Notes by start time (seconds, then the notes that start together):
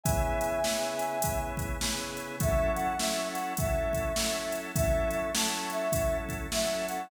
0.03 C#3 B3 E4 G#4 E5 G#5, kick, closed hi-hat
0.41 closed hi-hat
0.64 C#3 B3 E4 G#4, snare
0.99 closed hi-hat
1.22 C#3 B3 E4 G#4, kick, closed hi-hat
1.57 kick, closed hi-hat
1.81 C#3 B3 E4 G#4, snare
2.17 closed hi-hat
2.40 F#3 C#4 E4 A4 E5, kick, closed hi-hat
2.75 F#5, closed hi-hat
2.99 F#3 C#4 E4 A4 E5, snare
3.33 F#5, closed hi-hat
3.57 F#3 C#4 E4 A4 E5, kick, closed hi-hat
3.93 kick, closed hi-hat
4.16 F#3 C#4 E4 A4, snare
4.52 closed hi-hat
4.76 F#3 C#4 E4 A4 E5, kick, closed hi-hat
5.11 E5, closed hi-hat
5.34 F#3 C#4 E4 A4 A5, snare
5.70 E5, closed hi-hat
5.92 F#3 C#4 E4 A4, kick, closed hi-hat
6.29 kick, closed hi-hat
6.52 F#3 C#4 E4 A4 E5, snare
6.88 F#5, closed hi-hat